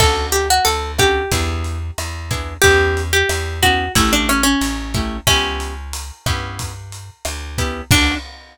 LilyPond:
<<
  \new Staff \with { instrumentName = "Acoustic Guitar (steel)" } { \time 4/4 \key d \major \tempo 4 = 91 a'8 g'16 fis'16 a'8 g'2~ g'8 | g'8. g'8. fis'8 e'16 d'16 cis'16 cis'4~ cis'16 | cis'2 r2 | d'4 r2. | }
  \new Staff \with { instrumentName = "Acoustic Guitar (steel)" } { \time 4/4 \key d \major <cis' d' fis' a'>4. <cis' d' fis' a'>8 <b d' e' gis'>4. <b d' e' gis'>8 | <b cis' e' g'>4. <b cis' e' g'>8 <a cis' e' g'>4. <a cis' e' g'>8 | <b cis' e' g'>4. <b cis' e' g'>2 <b cis' e' g'>8 | <cis' d' fis' a'>4 r2. | }
  \new Staff \with { instrumentName = "Electric Bass (finger)" } { \clef bass \time 4/4 \key d \major d,4 d,4 e,4 e,4 | e,4 e,4 a,,4 a,,4 | cis,4. g,4. d,4 | d,4 r2. | }
  \new DrumStaff \with { instrumentName = "Drums" } \drummode { \time 4/4 <cymc bd ss>8 hh8 hh8 <hh bd ss>8 <hh bd>8 hh8 <hh ss>8 <hh bd>8 | <hh bd>8 hh8 <hh ss>8 <hh bd>8 <hh bd>8 <hh ss>8 hh8 <hh bd>8 | <hh bd ss>8 hh8 hh8 <hh bd ss>8 <hh bd>8 hh8 <hh ss>8 <hh bd>8 | <cymc bd>4 r4 r4 r4 | }
>>